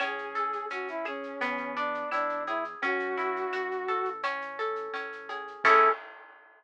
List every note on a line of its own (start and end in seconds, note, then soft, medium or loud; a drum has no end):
0.00 0.64 A1 medium
0.00 0.70 C#4 medium
0.00 0.66 G#4 medium
0.00 cowbell medium
0.00 claves medium
0.00 shaker medium
0.18 shaker medium
0.35 1.36 A4 medium
0.35 shaker medium
0.53 shaker medium
0.70 1.34 A1 medium
0.70 1.38 C#4 medium
0.70 0.88 F#4 medium
0.70 shaker medium
0.88 1.06 E4 medium
0.88 shaker medium
1.05 1.74 C#4 medium
1.05 1.39 G#4 medium
1.05 claves medium
1.05 shaker medium
1.23 shaker medium
1.41 2.04 E2 loud
1.41 2.75 B3 medium
1.41 cowbell medium
1.41 shaker medium
1.58 shaker medium
1.76 2.77 D4 medium
1.76 2.10 D4 medium
1.76 shaker medium
1.94 shaker medium
2.11 2.75 E2 medium
2.11 2.44 D4 medium
2.11 2.79 E4 medium
2.11 cowbell medium
2.11 claves medium
2.11 shaker medium
2.29 shaker medium
2.47 2.64 E4 medium
2.47 2.81 G#4 medium
2.47 cowbell medium
2.47 shaker medium
2.64 shaker medium
2.82 3.46 F#2 medium
2.82 4.17 C#4 medium
2.82 4.10 F#4 loud
2.82 cowbell medium
2.82 shaker medium
2.99 shaker medium
3.17 4.18 E4 medium
3.17 shaker medium
3.36 shaker medium
3.52 3.88 F#2 medium
3.52 4.20 F#4 medium
3.52 claves medium
3.52 shaker medium
3.71 shaker medium
3.88 4.89 A1 medium
3.88 4.22 A4 medium
3.88 shaker medium
4.05 shaker medium
4.23 4.93 C#4 medium
4.23 cowbell medium
4.23 claves medium
4.23 shaker medium
4.41 shaker medium
4.59 5.60 A4 medium
4.59 shaker medium
4.76 shaker medium
4.93 5.57 A1 medium
4.93 5.61 C#4 medium
4.93 cowbell medium
4.93 shaker medium
5.12 shaker medium
5.29 5.63 G#4 medium
5.29 cowbell medium
5.29 shaker medium
5.48 shaker medium
5.64 5.89 A2 medium
5.64 5.89 C#4 loud
5.64 5.89 E4 medium
5.64 5.89 G#4 loud
5.64 5.89 A4 medium
5.64 5.90 A4 loud
5.64 kick loud
5.64 crash loud